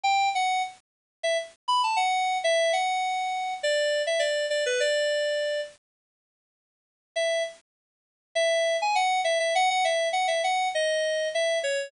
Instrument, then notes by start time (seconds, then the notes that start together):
electric piano 2
0.03 G5
0.35 F#5
1.23 E5
1.68 B5
1.83 A5
1.96 F#5
2.44 E5
2.73 F#5
3.63 D5
4.07 E5
4.19 D5
4.50 D5
4.66 B4
4.80 D5
7.16 E5
8.35 E5
8.82 G#5
8.95 F#5
9.24 E5
9.40 E5
9.55 F#5
9.70 F#5
9.84 E5
10.13 F#5
10.27 E5
10.44 F#5
10.75 D#5
11.34 E5
11.63 C#5